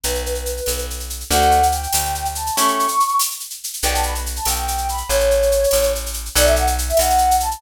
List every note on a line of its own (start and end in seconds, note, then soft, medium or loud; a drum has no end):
0.04 0.61 B1 medium
0.04 0.23 B4 medium
0.04 shaker medium
0.15 shaker medium
0.26 0.80 B4 medium
0.26 shaker medium
0.35 shaker medium
0.46 shaker medium
0.57 shaker medium
0.66 1.24 B1 medium
0.66 tambourine medium
0.66 shaker medium
0.78 shaker medium
0.90 shaker medium
1.00 shaker medium
1.10 shaker medium
1.20 shaker medium
1.30 1.87 D2 loud
1.30 1.60 A3 loud
1.30 1.60 D4 medium
1.30 1.60 F#4 loud
1.30 1.66 F#5 medium
1.30 shaker medium
1.42 shaker medium
1.51 shaker medium
1.63 shaker medium
1.72 2.24 G5 medium
1.72 shaker medium
1.83 shaker medium
1.93 2.50 D2 medium
1.93 tambourine medium
1.93 shaker medium
2.05 shaker medium
2.15 shaker medium
2.25 shaker medium
2.35 2.56 A5 medium
2.35 shaker medium
2.46 shaker medium
2.56 2.87 A3 loud
2.56 2.87 C#4 loud
2.56 2.87 E4 loud
2.56 2.87 G4 medium
2.56 3.15 C#6 medium
2.56 shaker loud
2.68 shaker medium
2.79 shaker medium
2.88 shaker medium
3.00 shaker medium
3.08 shaker medium
3.19 tambourine medium
3.19 shaker loud
3.31 shaker medium
3.40 shaker medium
3.50 shaker medium
3.64 shaker medium
3.73 shaker medium
3.82 4.40 B1 loud
3.82 4.14 B3 loud
3.82 4.14 D4 loud
3.82 4.14 G4 loud
3.82 3.93 G5 loud
3.82 shaker medium
3.94 4.04 A5 medium
3.94 shaker medium
4.03 4.14 B5 medium
4.03 shaker medium
4.15 shaker medium
4.26 shaker medium
4.36 4.47 A5 medium
4.36 shaker medium
4.45 5.03 B1 medium
4.45 4.87 G5 medium
4.45 tambourine medium
4.45 shaker medium
4.55 shaker medium
4.68 shaker medium
4.78 shaker medium
4.89 5.10 B5 medium
4.89 shaker medium
4.97 shaker medium
5.09 5.66 A1 loud
5.09 5.90 C#5 medium
5.09 shaker medium
5.20 shaker medium
5.31 shaker medium
5.42 shaker medium
5.51 shaker medium
5.64 shaker medium
5.71 6.29 A1 medium
5.71 tambourine medium
5.71 shaker medium
5.83 shaker medium
5.95 shaker medium
6.06 shaker medium
6.14 shaker medium
6.25 shaker medium
6.35 6.93 B1 loud
6.35 6.65 A4 loud
6.35 6.65 B4 loud
6.35 6.45 D5 loud
6.35 6.65 D5 loud
6.35 6.65 F#5 loud
6.35 shaker loud
6.45 6.55 E5 medium
6.45 shaker medium
6.56 6.67 F#5 medium
6.56 shaker medium
6.67 shaker medium
6.78 shaker medium
6.89 6.99 E5 medium
6.89 shaker medium
6.97 7.56 B1 medium
6.97 7.35 F#5 medium
6.97 tambourine medium
6.97 shaker medium
7.10 shaker medium
7.18 shaker medium
7.31 shaker medium
7.40 7.61 A5 medium
7.40 shaker medium
7.51 shaker medium